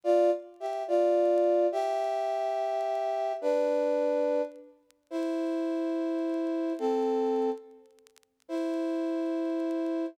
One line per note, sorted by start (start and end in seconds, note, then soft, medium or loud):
0.04 0.30 F4 medium
0.04 0.30 D5 loud
0.60 0.83 G4 medium
0.60 0.83 E5 medium
0.88 1.67 F4 medium
0.88 1.67 D5 medium
1.72 3.33 G4 loud
1.72 3.33 E5 loud
3.41 4.42 D4 medium
3.41 4.42 B4 medium
5.11 6.73 E4 medium
5.11 6.73 C5 medium
6.79 7.50 C4 medium
6.79 7.50 A4 medium
8.48 10.06 E4 medium
8.48 10.06 C5 medium